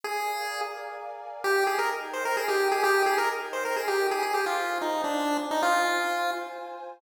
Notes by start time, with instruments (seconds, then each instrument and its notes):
0.03 lead 1 (square) G#4, pad 5 (bowed) A#4 D5 F5 G#5
1.44 pad 5 (bowed) D#4 A#4 G5, lead 1 (square) G4
1.67 lead 1 (square) G#4
1.79 lead 1 (square) A#4
2.13 lead 1 (square) C5
2.25 lead 1 (square) A#4
2.37 lead 1 (square) G#4
2.48 lead 1 (square) G4
2.72 lead 1 (square) G#4
2.84 lead 1 (square) G4
3.06 lead 1 (square) G#4
3.18 lead 1 (square) A#4
3.53 lead 1 (square) C5
3.65 lead 1 (square) A#4
3.76 lead 1 (square) G#4
3.88 lead 1 (square) G4
4.11 lead 1 (square) G#4
4.22 pad 5 (bowed) F4 C5 G#5, lead 1 (square) G#4
4.34 lead 1 (square) G4
4.46 lead 1 (square) F4
4.81 lead 1 (square) D#4
5.04 lead 1 (square) D4
5.51 lead 1 (square) D#4
5.62 lead 1 (square) F4